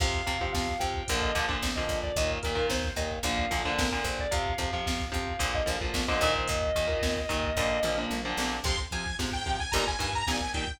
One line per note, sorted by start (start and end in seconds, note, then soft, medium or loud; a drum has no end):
0.00 0.23 F2 medium
0.00 0.22 C3 medium
0.00 0.22 F3 medium
0.00 0.40 F5 medium
0.00 kick medium
0.00 crash medium
0.14 kick medium
0.27 0.50 F2 medium
0.27 0.37 C3 medium
0.27 0.37 F3 medium
0.27 kick medium
0.27 closed hi-hat medium
0.40 0.73 C3 medium
0.40 0.73 F3 medium
0.40 0.52 F5 medium
0.40 kick medium
0.53 0.77 F2 medium
0.53 0.75 F5 medium
0.53 kick medium
0.53 snare medium
0.68 kick medium
0.80 1.04 F2 medium
0.80 1.02 C3 medium
0.80 1.02 F3 medium
0.80 1.13 G5 medium
0.80 kick medium
0.80 closed hi-hat medium
0.94 kick medium
1.08 1.32 A#1 medium
1.08 1.31 A#2 medium
1.08 1.31 D3 medium
1.08 1.31 F3 medium
1.08 kick medium
1.08 closed hi-hat medium
1.22 1.35 D#5 medium
1.22 kick medium
1.35 1.58 A#1 medium
1.35 1.46 A#2 medium
1.35 1.46 D3 medium
1.35 1.46 F3 medium
1.35 kick medium
1.35 closed hi-hat medium
1.48 1.70 A#2 medium
1.48 1.70 D3 medium
1.48 1.70 F3 medium
1.48 kick medium
1.62 1.85 A#1 medium
1.62 kick medium
1.62 snare medium
1.76 2.10 A#2 medium
1.76 2.10 D3 medium
1.76 2.10 F3 medium
1.76 1.98 D#5 medium
1.76 kick medium
1.89 2.12 A#1 medium
1.89 kick medium
1.89 closed hi-hat medium
2.03 2.16 D5 medium
2.03 kick medium
2.16 2.39 D#2 medium
2.16 2.39 A#2 medium
2.16 2.39 D#3 medium
2.16 2.30 D#5 medium
2.16 kick medium
2.16 closed hi-hat medium
2.30 kick medium
2.43 2.67 D#2 medium
2.43 2.55 A#2 medium
2.43 2.55 D#3 medium
2.43 2.65 A#4 medium
2.43 kick medium
2.43 closed hi-hat medium
2.55 2.88 A#2 medium
2.55 2.88 D#3 medium
2.55 kick medium
2.69 2.93 D#2 medium
2.69 2.93 C5 medium
2.69 kick medium
2.69 snare medium
2.84 kick medium
2.96 3.19 D#2 medium
2.96 3.18 A#2 medium
2.96 3.18 D#3 medium
2.96 3.09 D#5 medium
2.96 kick medium
2.96 closed hi-hat medium
3.11 kick medium
3.23 3.46 A#1 medium
3.23 3.45 A#2 medium
3.23 3.45 D3 medium
3.23 3.45 F3 medium
3.23 3.70 F5 medium
3.23 kick medium
3.23 closed hi-hat medium
3.38 kick medium
3.51 3.74 A#1 medium
3.51 3.62 A#2 medium
3.51 3.62 D3 medium
3.51 3.62 F3 medium
3.51 kick medium
3.51 closed hi-hat medium
3.65 3.87 A#2 medium
3.65 3.87 D3 medium
3.65 3.87 F3 medium
3.65 kick medium
3.78 4.01 A#1 medium
3.78 4.04 A#4 medium
3.78 kick medium
3.78 snare loud
3.92 4.25 A#2 medium
3.92 4.25 D3 medium
3.92 4.25 F3 medium
3.92 kick medium
4.04 4.27 A#1 medium
4.04 4.18 C5 medium
4.04 kick medium
4.04 closed hi-hat soft
4.19 4.33 D5 medium
4.19 kick medium
4.31 4.55 F2 medium
4.31 4.53 C3 loud
4.31 4.53 F3 medium
4.31 4.72 F5 medium
4.31 kick medium
4.31 closed hi-hat medium
4.47 kick medium
4.58 4.81 F2 medium
4.58 4.69 C3 medium
4.58 4.69 F3 medium
4.58 kick medium
4.58 closed hi-hat medium
4.73 5.05 C3 medium
4.73 5.05 F3 medium
4.73 4.85 F5 medium
4.73 kick medium
4.85 5.10 F2 medium
4.85 5.07 F5 medium
4.85 kick medium
4.85 snare medium
5.00 kick medium
5.12 5.37 F2 medium
5.12 5.33 C3 medium
5.12 5.33 F3 medium
5.12 5.52 F5 medium
5.12 kick medium
5.12 closed hi-hat medium
5.28 kick medium
5.39 5.63 A#1 medium
5.39 5.61 A#2 medium
5.39 5.61 D3 medium
5.39 5.61 F3 medium
5.39 kick medium
5.39 closed hi-hat medium
5.55 5.68 D#5 medium
5.55 kick medium
5.66 5.90 A#1 medium
5.66 5.77 A#2 medium
5.66 5.77 D3 medium
5.66 5.77 F3 medium
5.66 kick medium
5.66 closed hi-hat medium
5.81 6.03 A#2 medium
5.81 6.03 D3 medium
5.81 6.03 F3 medium
5.81 kick medium
5.94 6.17 A#1 medium
5.94 kick medium
5.94 snare medium
6.08 6.21 A#2 medium
6.08 6.21 D3 medium
6.08 6.21 F3 medium
6.08 6.33 D#5 medium
6.08 kick medium
6.21 6.44 A#1 medium
6.21 6.70 A#2 medium
6.21 6.70 D#3 loud
6.21 kick medium
6.21 closed hi-hat medium
6.35 6.48 C5 medium
6.35 kick medium
6.48 6.72 D#2 medium
6.48 8.00 D#5 medium
6.48 kick medium
6.48 closed hi-hat medium
6.63 kick medium
6.75 6.99 D#2 medium
6.75 6.86 A#2 medium
6.75 6.86 D#3 medium
6.75 kick medium
6.75 closed hi-hat medium
6.87 7.20 A#2 medium
6.87 7.20 D#3 medium
6.87 kick medium
7.02 7.26 D#2 medium
7.02 kick medium
7.02 snare medium
7.17 kick medium
7.29 7.53 D#2 medium
7.29 7.50 A#2 medium
7.29 7.50 D#3 medium
7.29 kick medium
7.29 closed hi-hat medium
7.44 kick medium
7.56 7.80 A#1 medium
7.56 7.79 A#2 medium
7.56 7.79 D3 medium
7.56 7.79 F3 medium
7.56 kick medium
7.56 floor tom medium
7.83 8.06 A#1 medium
7.83 7.95 A#2 medium
7.83 7.95 D3 medium
7.83 7.95 F3 medium
7.83 mid tom medium
7.98 8.19 A#2 medium
7.98 8.19 D3 medium
7.98 8.19 F3 medium
8.10 8.34 A#1 medium
8.10 high tom medium
8.25 8.57 A#2 medium
8.25 8.57 D3 medium
8.25 8.57 F3 medium
8.37 8.60 A#1 medium
8.37 snare medium
8.64 8.87 F2 medium
8.64 8.76 C3 medium
8.64 8.76 F3 medium
8.64 8.79 C6 medium
8.64 kick medium
8.64 crash medium
8.78 kick medium
8.91 9.04 C3 medium
8.91 9.15 F3 medium
8.91 9.04 F3 medium
8.91 9.15 G#5 medium
8.91 kick medium
8.91 closed hi-hat medium
9.06 kick medium
9.19 9.65 G#2 medium
9.19 9.30 C3 medium
9.19 9.30 F3 medium
9.19 kick medium
9.19 snare medium
9.32 9.59 G5 medium
9.32 kick medium
9.46 9.57 C3 medium
9.46 9.57 F3 medium
9.46 kick medium
9.46 closed hi-hat medium
9.60 9.73 G#5 medium
9.60 kick medium
9.72 9.96 G1 medium
9.72 9.84 A#2 medium
9.72 9.84 D#3 medium
9.72 9.84 G3 medium
9.72 9.84 A#5 medium
9.72 kick medium
9.72 closed hi-hat medium
9.87 10.00 G#5 medium
9.87 kick medium
9.99 10.23 G2 medium
9.99 10.10 A#2 medium
9.99 10.10 D#3 medium
9.99 10.10 G3 medium
9.99 10.13 G#5 medium
9.99 kick medium
9.99 closed hi-hat medium
10.13 10.28 A#5 medium
10.13 kick medium
10.27 10.73 A#1 medium
10.27 10.39 A#2 medium
10.27 10.39 D#3 medium
10.27 10.39 G3 medium
10.27 10.50 G#5 medium
10.27 kick medium
10.27 snare medium
10.40 kick medium
10.54 10.65 A#2 medium
10.54 10.65 D#3 medium
10.54 10.65 G3 medium
10.54 10.76 G5 medium
10.54 kick medium
10.54 closed hi-hat medium
10.68 kick medium